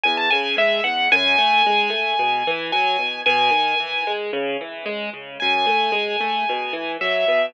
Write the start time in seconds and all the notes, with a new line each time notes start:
0.03 E2 G#5
0.17 A5
0.30 C#3 G#5
0.57 G#3 E5
0.84 E2 F#5
1.12 F#2 G#5
1.38 A3
1.66 G#3
1.90 A3
2.19 B2
2.47 E3
2.72 F#3 G#5
2.99 B2
3.26 B2 G#5
3.51 D#3
3.80 E3
4.07 G#3
4.33 C#3
4.61 E3
4.86 G#3
5.14 C#3
5.40 F#2 G#5
5.66 A3
5.92 G#3
6.20 A3
6.49 B2
6.73 E3
7.01 F#3 E5
7.28 B2